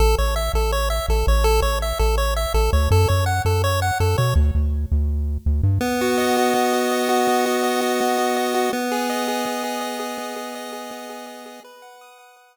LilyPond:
<<
  \new Staff \with { instrumentName = "Lead 1 (square)" } { \time 4/4 \key a \major \tempo 4 = 165 a'8 cis''8 e''8 a'8 cis''8 e''8 a'8 cis''8 | a'8 cis''8 e''8 a'8 cis''8 e''8 a'8 cis''8 | a'8 cis''8 fis''8 a'8 cis''8 fis''8 a'8 cis''8 | r1 |
\key b \major b8 fis'8 dis''8 fis'8 b8 fis'8 dis''8 fis'8 | b8 fis'8 dis''8 fis'8 b8 fis'8 dis''8 fis'8 | b8 gis'8 dis''8 gis'8 b8 gis'8 dis''8 gis'8 | b8 gis'8 dis''8 gis'8 b8 gis'8 dis''8 gis'8 |
b'8 fis''8 dis'''8 fis''8 b'8 fis''8 r4 | }
  \new Staff \with { instrumentName = "Synth Bass 1" } { \clef bass \time 4/4 \key a \major a,,8 a,,4 a,,4. a,,8 a,,8~ | a,,8 a,,4 a,,4. a,,8 d,8 | fis,8 fis,4 fis,4. fis,8 b,8 | d,8 d,4 d,4. d,8 g,8 |
\key b \major r1 | r1 | r1 | r1 |
r1 | }
>>